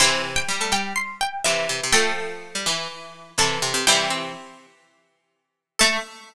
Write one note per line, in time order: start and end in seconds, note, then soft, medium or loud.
0.00 0.42 C3 medium
0.00 0.42 E3 medium
0.00 0.22 C4 loud
0.00 1.69 E4 medium
0.00 0.34 C6 medium
0.36 0.69 G5 medium
0.48 1.32 G3 medium
0.60 0.72 A3 loud
0.72 0.93 G3 loud
0.72 0.93 G5 loud
0.96 1.15 C6 medium
1.21 1.40 G5 medium
1.44 1.67 C3 loud
1.44 1.85 E3 medium
1.44 1.84 E5 medium
1.69 1.81 C3 loud
1.83 1.95 C3 loud
1.92 2.55 F3 medium
1.92 2.13 A3 loud
1.92 2.55 A3 medium
1.92 3.17 A4 medium
1.92 3.33 G5 loud
2.55 2.66 G3 loud
2.66 3.30 E3 medium
2.66 2.88 E3 medium
3.38 3.58 C3 loud
3.38 3.81 E3 medium
3.38 3.79 A4 medium
3.38 3.80 A5 medium
3.62 3.73 C3 loud
3.74 3.85 C3 loud
3.87 4.32 C3 medium
3.87 4.32 E3 medium
3.87 4.10 G3 loud
3.87 4.58 E4 loud
3.87 4.51 G5 loud
4.10 4.79 C4 medium
5.79 5.98 A3 loud
5.79 5.96 A4 loud
5.79 5.98 A5 loud